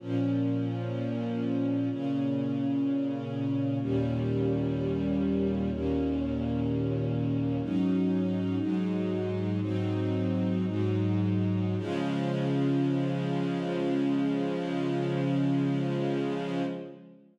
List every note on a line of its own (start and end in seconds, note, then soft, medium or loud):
0.00 1.89 A#2 medium
0.00 1.89 F3 medium
0.00 1.89 C#4 medium
1.90 3.79 A#2 medium
1.90 3.79 C#3 medium
1.90 3.79 C#4 medium
3.81 5.70 D#2 medium
3.81 5.70 A#2 medium
3.81 5.70 G3 medium
3.81 5.70 C#4 medium
5.71 7.60 D#2 medium
5.71 7.60 A#2 medium
5.71 7.60 A#3 medium
5.71 7.60 C#4 medium
7.62 8.58 G#2 medium
7.62 8.58 F#3 medium
7.62 8.58 C#4 medium
7.62 8.58 D#4 medium
8.59 9.60 G#2 medium
8.59 9.60 F#3 medium
8.59 9.60 G#3 medium
8.59 9.60 D#4 medium
9.60 10.65 G#2 medium
9.60 10.65 F#3 medium
9.60 10.65 C4 medium
9.60 10.65 D#4 medium
10.66 11.76 G#2 medium
10.66 11.76 F#3 medium
10.66 11.76 G#3 medium
10.66 11.76 D#4 medium
11.77 16.62 C#3 loud
11.77 16.62 F3 loud
11.77 16.62 G#3 loud